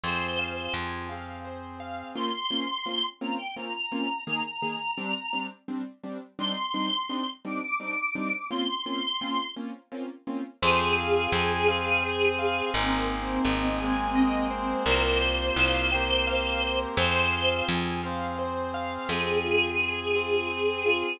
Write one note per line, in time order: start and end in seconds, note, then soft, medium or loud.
0.04 0.69 F2 medium
0.04 1.09 C4 medium
0.04 1.10 F4 medium
0.04 1.09 G#4 medium
0.04 0.35 C5 medium
0.04 0.73 C5 loud
0.39 0.71 F5 medium
0.74 2.04 F2 medium
0.74 1.06 G#5 medium
1.09 2.15 C4 medium
1.09 2.15 G#4 medium
1.09 2.15 C5 medium
1.09 1.41 F5 medium
1.45 1.76 C5 medium
1.80 2.12 F5 medium
2.15 2.29 A#3 medium
2.15 2.29 C4 medium
2.15 2.29 C#4 medium
2.15 2.29 F4 medium
2.15 3.05 C6 loud
2.51 2.65 A#3 medium
2.51 2.65 C4 medium
2.51 2.65 C#4 medium
2.51 2.65 F4 medium
2.86 3.00 A#3 medium
2.86 3.00 C4 medium
2.86 3.00 C#4 medium
2.86 3.00 F4 medium
3.21 3.35 A#3 medium
3.21 3.35 C4 medium
3.21 3.35 C#4 medium
3.21 3.35 F4 medium
3.21 3.38 A#5 medium
3.38 3.55 G5 medium
3.56 3.71 A#3 medium
3.56 3.71 C4 medium
3.56 3.71 C#4 medium
3.56 3.71 F4 medium
3.56 3.73 A#5 medium
3.74 4.24 A#5 medium
3.92 4.06 A#3 medium
3.92 4.06 C4 medium
3.92 4.06 C#4 medium
3.92 4.06 F4 medium
4.26 4.41 D#3 medium
4.26 4.41 A#3 medium
4.26 4.41 G#4 medium
4.26 5.45 A#5 medium
4.62 4.76 D#3 medium
4.62 4.76 A#3 medium
4.62 4.76 G#4 medium
4.98 5.12 G3 medium
4.98 5.12 C4 medium
4.98 5.12 D4 medium
5.33 5.47 G3 medium
5.33 5.47 C4 medium
5.33 5.47 D4 medium
5.68 5.82 G3 medium
5.68 5.82 C4 medium
5.68 5.82 D4 medium
6.04 6.18 G3 medium
6.04 6.18 C4 medium
6.04 6.18 D4 medium
6.39 6.53 G3 medium
6.39 6.53 C4 medium
6.39 6.53 D4 medium
6.39 6.53 D#4 medium
6.39 7.29 C6 loud
6.74 6.88 G3 medium
6.74 6.88 C4 medium
6.74 6.88 D4 medium
6.74 6.88 D#4 medium
7.09 7.24 G3 medium
7.09 7.24 C4 medium
7.09 7.24 D4 medium
7.09 7.24 D#4 medium
7.45 7.59 G3 medium
7.45 7.59 C4 medium
7.45 7.59 D4 medium
7.45 7.59 D#4 medium
7.45 7.61 D6 medium
7.62 7.79 D6 medium
7.80 7.94 G3 medium
7.80 7.94 C4 medium
7.80 7.94 D4 medium
7.80 7.94 D#4 medium
7.80 7.97 D6 loud
7.98 8.47 D6 medium
8.15 8.29 G3 medium
8.15 8.29 C4 medium
8.15 8.29 D4 medium
8.15 8.29 D#4 medium
8.50 8.65 A#3 medium
8.50 8.65 C4 medium
8.50 8.65 C#4 medium
8.50 8.65 F4 medium
8.50 9.49 C6 loud
8.86 9.00 A#3 medium
8.86 9.00 C4 medium
8.86 9.00 C#4 medium
8.86 9.00 F4 medium
9.21 9.35 A#3 medium
9.21 9.35 C4 medium
9.21 9.35 C#4 medium
9.21 9.35 F4 medium
9.56 9.71 A#3 medium
9.56 9.71 C4 medium
9.56 9.71 C#4 medium
9.56 9.71 F4 medium
9.92 10.06 A#3 medium
9.92 10.06 C4 medium
9.92 10.06 C#4 medium
9.92 10.06 F4 medium
10.27 10.41 A#3 medium
10.27 10.41 C4 medium
10.27 10.41 C#4 medium
10.27 10.41 F4 medium
10.62 11.27 F2 loud
10.62 11.68 C4 loud
10.62 11.68 F4 loud
10.62 12.70 G#4 loud
10.62 11.68 G#4 loud
10.62 10.94 C5 loud
10.98 11.29 F5 medium
11.32 12.62 F2 medium
11.32 11.65 G#5 medium
11.68 12.73 C4 loud
11.68 12.73 G#4 loud
11.68 12.73 C5 loud
11.68 12.00 F5 loud
12.04 12.35 C5 medium
12.39 12.71 F5 loud
12.74 13.39 G#1 loud
12.74 13.80 A#3 loud
12.74 14.77 C4 loud
12.74 13.80 C4 loud
12.74 13.80 D#4 loud
12.74 13.80 G#4 loud
12.74 13.06 A#4 loud
13.09 13.41 C5 medium
13.45 14.75 G#1 medium
13.45 13.76 D#5 medium
13.80 14.86 G#3 loud
13.80 14.85 A#3 loud
13.80 14.85 C4 loud
13.80 14.86 G#4 loud
13.80 14.12 G#5 loud
14.15 14.47 D#5 loud
14.51 14.82 C5 medium
14.86 15.51 C2 loud
14.86 15.90 A#3 loud
14.86 15.90 C4 loud
14.86 15.90 F4 loud
14.86 15.90 G4 loud
14.86 15.18 A#4 loud
14.86 16.79 C5 loud
15.21 15.53 C5 medium
15.56 16.86 C2 medium
15.56 15.88 F5 loud
15.92 16.98 A#3 loud
15.92 16.96 C4 loud
15.92 16.98 G4 loud
15.92 16.98 A#4 loud
15.92 16.24 G5 medium
16.27 16.59 F5 loud
16.62 16.94 C5 medium
16.96 17.62 F2 loud
16.96 18.01 C4 loud
16.96 18.01 F4 loud
16.96 18.01 G#4 loud
16.96 17.29 C5 loud
16.96 17.67 C5 loud
17.33 17.65 F5 medium
17.68 18.98 F2 medium
17.68 18.00 G#5 medium
18.04 19.09 C4 loud
18.04 19.09 G#4 loud
18.04 19.09 C5 loud
18.04 18.35 F5 medium
18.39 18.71 C5 medium
18.74 19.06 F5 loud
19.09 21.04 F2 medium
19.09 20.14 C4 loud
19.09 19.41 C4 medium
19.09 20.14 F4 medium
19.09 20.14 G#4 loud
19.09 21.17 G#4 loud
19.45 19.76 F4 medium
19.80 20.12 G#4 medium
20.14 21.19 C4 loud
20.14 20.47 F4 medium
20.14 21.19 G#4 medium
20.14 21.19 C5 loud
20.51 20.82 C4 medium
20.86 21.18 F4 medium